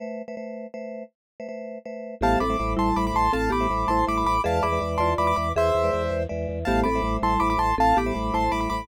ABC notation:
X:1
M:6/8
L:1/16
Q:3/8=108
K:Am
V:1 name="Acoustic Grand Piano"
z12 | z12 | [fa]2 [bd']4 [ac']2 [bd'] [bd'] [ac']2 | [fa]2 [bd']4 [ac']2 [bd'] [bd'] [bd']2 |
[fa]2 [bd']4 [ac']2 [bd'] [bd'] [bd']2 | [ce]8 z4 | [fa]2 [bd']4 [ac']2 [bd'] [bd'] [ac']2 | [fa]2 [bd']4 [ac']2 [bd'] [bd'] [bd']2 |]
V:2 name="Marimba"
z12 | z12 | [B,G]2 [CA]2 z2 [G,E]4 z2 | [CA]2 [B,G]2 z2 [Ec]4 z2 |
[^Ge]2 [Ge]2 z2 [Fd]4 z2 | [^Ge]6 z6 | [B,G]2 [CA]2 z2 [G,E]4 z2 | [CA]2 [B,G]2 z2 [Ec]4 z2 |]
V:3 name="Vibraphone"
[A,Bce]3 [A,Bce] [A,Bce]4 [A,Bce]4- | [A,Bce]3 [A,Bce] [A,Bce]4 [A,Bce]4 | [G,A,ce]3 [G,A,ce] [G,A,ce]4 [G,A,ce]4- | [G,A,ce]3 [G,A,ce] [G,A,ce]4 [G,A,ce]4 |
[^G,Bde]3 [G,Bde] [G,Bde]4 [G,Bde]4- | [^G,Bde]3 [G,Bde] [G,Bde]4 [G,Bde]4 | [G,A,ce]3 [G,A,ce] [G,A,ce]4 [G,A,ce]4- | [G,A,ce]3 [G,A,ce] [G,A,ce]4 [G,A,ce]4 |]
V:4 name="Drawbar Organ" clef=bass
z12 | z12 | A,,,2 A,,,2 A,,,2 A,,,2 A,,,2 A,,,2 | A,,,2 A,,,2 A,,,2 A,,,2 A,,,2 A,,,2 |
E,,2 E,,2 E,,2 E,,2 E,,2 E,,2 | E,,2 E,,2 E,,2 E,,2 E,,2 E,,2 | A,,,2 A,,,2 A,,,2 A,,,2 A,,,2 A,,,2 | A,,,2 A,,,2 A,,,2 A,,,2 A,,,2 A,,,2 |]